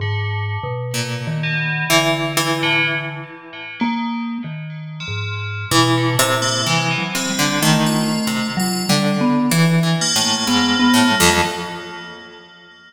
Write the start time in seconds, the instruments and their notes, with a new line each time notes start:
0.00 vibraphone G#2, tubular bells D3
0.63 vibraphone B2
0.94 pizzicato strings A#2
1.27 vibraphone D#3
1.43 tubular bells B2
1.90 vibraphone D3, pizzicato strings E3
2.37 pizzicato strings E3
2.63 tubular bells A2
3.80 tubular bells D#3, vibraphone A#3
4.44 vibraphone D#3
5.00 tubular bells F3
5.08 vibraphone G#2
5.71 vibraphone B2, pizzicato strings E3
5.97 tubular bells D3
6.19 vibraphone A#2, pizzicato strings C3
6.42 tubular bells A#3
6.66 vibraphone C3, pizzicato strings E3, tubular bells G#3
6.91 tubular bells E3
6.98 vibraphone F#3
7.15 pizzicato strings C3, tubular bells C4
7.30 vibraphone G3
7.39 pizzicato strings D3
7.62 pizzicato strings D#3, vibraphone A3
7.86 tubular bells F4
8.27 pizzicato strings C3
8.57 vibraphone F#3, tubular bells F4
8.89 pizzicato strings D3, vibraphone G3
9.21 vibraphone B3
9.51 pizzicato strings E3, vibraphone E3
9.83 pizzicato strings E3
10.01 tubular bells A#3
10.16 pizzicato strings A2
10.24 vibraphone A#3
10.47 pizzicato strings G#2, vibraphone B3
10.80 vibraphone B3
10.94 pizzicato strings A2
11.11 vibraphone G3
11.20 pizzicato strings F2